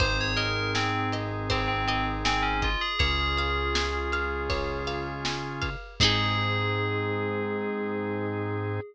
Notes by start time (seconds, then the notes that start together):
0.00 G#1 C4 D#4 G#4 C5, kick, ride
0.21 C#5
0.36 A#4 D#5, ride
0.75 C4 G#5, snare
1.12 D#5, ride
1.50 C4 C5, kick, ride
1.68 C4
1.88 C4 D#5, ride
2.25 C4 G#5, snare
2.43 C#4
2.62 F4 D#5, kick, ride
2.81 G#4
2.99 C#2 C#4 F4 G#4 C#5, kick, ride
3.38 F5, ride
3.75 G#5, snare
4.12 F5, ride
4.50 C#5, kick, ride
4.87 F5, ride
5.25 G#5, snare
5.62 F5, kick, ride
6.00 G#2 C4 D#4 G#4, kick, crash
6.04 G#4